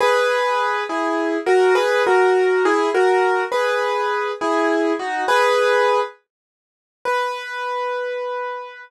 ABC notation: X:1
M:6/8
L:1/8
Q:3/8=68
K:B
V:1 name="Acoustic Grand Piano"
[GB]3 [EG]2 [FA] | [GB] [FA]2 [EG] [FA]2 | [GB]3 [EG]2 [DF] | [GB]3 z3 |
B6 |]